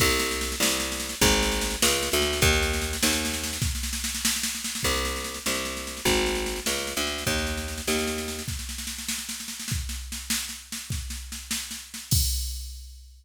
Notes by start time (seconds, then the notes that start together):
0.00 C2, kick, snare, crash
0.10 snare
0.19 snare
0.31 snare
0.41 snare
0.52 snare
0.60 C2, snare
0.69 snare
0.80 snare
0.92 snare
1.00 snare
1.09 snare
1.21 G#1, kick, snare
1.31 snare
1.42 snare
1.52 snare
1.61 snare
1.70 snare
1.82 C#2, snare
1.93 snare
2.03 snare
2.12 D2, snare
2.22 snare
2.33 snare
2.42 D#2, kick, snare
2.53 snare
2.63 snare
2.73 snare
2.82 snare
2.93 snare
3.03 D#2, snare
3.13 snare
3.25 snare
3.34 snare
3.44 snare
3.53 snare
3.62 kick, snare
3.75 snare
3.83 snare
3.93 snare
4.04 snare
4.15 snare
4.25 snare
4.36 snare
4.43 snare
4.55 snare
4.64 snare
4.75 snare
4.83 C2, kick, snare, crash
4.94 snare
5.05 snare
5.16 snare
5.24 snare
5.34 snare
5.46 C2, snare
5.55 snare
5.65 snare
5.77 snare
5.87 snare
5.97 snare
6.05 G#1, kick, snare
6.17 snare
6.26 snare
6.35 snare
6.46 snare
6.56 snare
6.66 C#2, snare
6.78 snare
6.87 snare
6.97 D2, snare
7.07 snare
7.18 snare
7.27 D#2, kick, snare
7.38 snare
7.47 snare
7.57 snare
7.68 snare
7.78 snare
7.87 D#2, snare
7.99 snare
8.07 snare
8.18 snare
8.28 snare
8.39 snare
8.48 kick, snare
8.59 snare
8.69 snare
8.78 snare
8.87 snare
8.98 snare
9.09 snare
9.18 snare
9.29 snare
9.40 snare
9.48 snare
9.60 snare
9.68 kick, snare
9.89 snare
10.12 snare
10.30 snare
10.49 snare
10.72 snare
10.90 kick, snare
11.10 snare
11.32 snare
11.51 snare
11.71 snare
11.94 snare
12.11 kick, crash